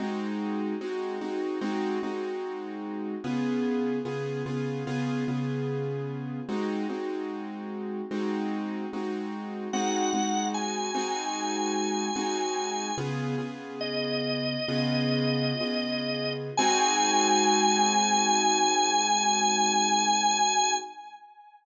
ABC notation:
X:1
M:4/4
L:1/8
Q:1/4=74
K:Ab
V:1 name="Drawbar Organ"
z8 | z8 | z8 | _g2 a6 |
"^rit." z2 e6 | a8 |]
V:2 name="Acoustic Grand Piano"
[A,CE_G]2 [A,CEG] [A,CEG] [A,CEG] [A,CEG]3 | [D,_CFA]2 [D,CFA] [D,CFA] [D,CFA] [D,CFA]3 | [A,CE_G] [A,CEG]3 [A,CEG]2 [A,CEG]2 | [A,CE_G] [A,CEG]2 [A,CEG]3 [A,CEG]2 |
"^rit." [D,_CFA] [D,CFA]3 [D,CFA]2 [D,CFA]2 | [A,CE_G]8 |]